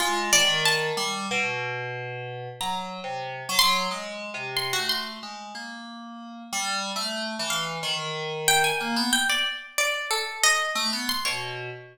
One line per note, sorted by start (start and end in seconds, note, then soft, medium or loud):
0.00 0.30 G#3 medium
0.00 0.29 F4 medium
0.32 0.91 D#3 loud
0.32 0.62 D5 loud
0.65 1.24 A5 medium
0.97 1.26 G3 loud
1.31 2.48 B2 loud
2.61 3.00 F#3 medium
2.61 2.90 A#5 medium
3.04 3.43 C3 medium
3.49 3.88 F#3 loud
3.59 3.88 C6 loud
3.91 4.30 G#3 medium
4.34 4.73 C3 medium
4.57 4.71 C6 medium
4.73 4.88 F#4 medium
4.79 5.18 A3 medium
4.89 5.19 C6 medium
5.23 5.52 G#3 soft
5.55 6.43 A#3 medium
6.53 6.92 G3 loud
6.96 7.35 A3 medium
7.39 7.78 E3 loud
7.50 7.79 F5 medium
7.83 8.71 D#3 loud
8.48 8.63 G5 loud
8.64 9.08 G#5 medium
8.80 8.95 A#3 medium
8.96 9.11 B3 loud
9.13 9.27 G5 medium
9.29 9.44 D5 medium
9.78 10.07 D5 medium
10.11 10.40 A4 medium
10.43 10.73 D#5 loud
10.75 10.90 A3 loud
10.93 11.07 B3 medium
11.09 11.24 C6 medium
11.25 11.70 B2 medium
11.25 11.69 C#5 medium